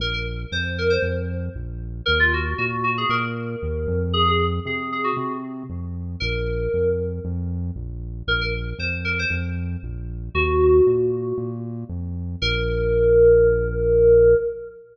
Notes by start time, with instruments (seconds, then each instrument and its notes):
0.00 synth bass 1 A#1, electric piano 2 A#4
0.14 electric piano 2 A#4
0.52 synth bass 1 F2, electric piano 2 C5
0.78 electric piano 2 A#4
0.90 electric piano 2 C5
1.02 synth bass 1 F2
1.55 synth bass 1 A#1
2.06 synth bass 1 D#2, electric piano 2 A#4
2.20 electric piano 2 F4
2.33 electric piano 2 F#4
2.58 synth bass 1 A#2, electric piano 2 F#4
2.84 electric piano 2 F#4
2.98 electric piano 2 G#4
3.09 synth bass 1 A#2, electric piano 2 A#4
3.62 synth bass 1 D#2
3.87 synth bass 1 F2
4.13 electric piano 2 G#4
4.28 electric piano 2 G#4
4.66 synth bass 1 C3, electric piano 2 G#4
4.92 electric piano 2 G#4
5.04 electric piano 2 F#4
5.17 synth bass 1 C3
5.70 synth bass 1 F2
6.20 synth bass 1 A#1, electric piano 2 A#4
6.73 synth bass 1 F2
7.25 synth bass 1 F2
7.76 synth bass 1 A#1
8.27 synth bass 1 A#1, electric piano 2 A#4
8.41 electric piano 2 A#4
8.78 synth bass 1 F2, electric piano 2 C5
9.05 electric piano 2 A#4
9.19 electric piano 2 C5
9.30 synth bass 1 F2
9.83 synth bass 1 A#1
10.34 synth bass 1 D#2, electric piano 2 F#4
10.87 synth bass 1 A#2
11.38 synth bass 1 A#2
11.89 synth bass 1 F2
12.42 synth bass 1 A#1, electric piano 2 A#4